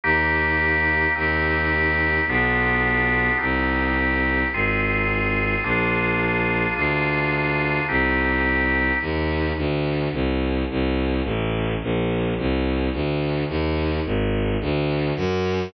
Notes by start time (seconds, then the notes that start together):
0.04 D#2 A#3 D#4 G4
1.15 D#2 C4 D#4 G4
2.27 B1 B3 D4 F4 G4
3.38 C2 C4 D#4 G4
4.53 G#1 C4 F4 G#4
5.63 A#1 A#3 D4 F4 G#4
6.76 D2 A#3 D4 F4 G#4
7.89 C2 C4 D#4 G4
9.01 D#2
9.57 D2
10.12 C2
10.70 C2
11.24 A1
11.82 A#1
12.38 C2
12.93 D2
13.48 D#2
14.05 G#1
14.61 D2
15.16 F#2